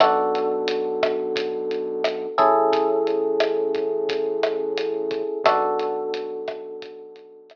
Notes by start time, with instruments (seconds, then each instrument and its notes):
0.00 synth bass 1 B1, electric piano 1 B3 D4 F#4 A4, kick, cross-stick, closed hi-hat
0.35 closed hi-hat
0.68 closed hi-hat
1.03 kick, cross-stick, closed hi-hat
1.36 kick, closed hi-hat
1.71 closed hi-hat
2.04 cross-stick, closed hi-hat
2.38 synth bass 1 A1, electric piano 1 C#4 E4 G#4 A4, kick, closed hi-hat
2.73 kick, closed hi-hat
3.07 closed hi-hat
3.40 cross-stick, closed hi-hat
3.75 kick, closed hi-hat
4.09 kick, closed hi-hat
4.43 cross-stick, closed hi-hat
4.78 closed hi-hat
5.11 kick, closed hi-hat
5.44 synth bass 1 B1, electric piano 1 B3 D4 F#4 A4, kick, cross-stick, closed hi-hat
5.79 closed hi-hat
6.14 closed hi-hat
6.48 kick, cross-stick, closed hi-hat
6.82 kick, closed hi-hat
7.16 closed hi-hat
7.50 cross-stick, closed hi-hat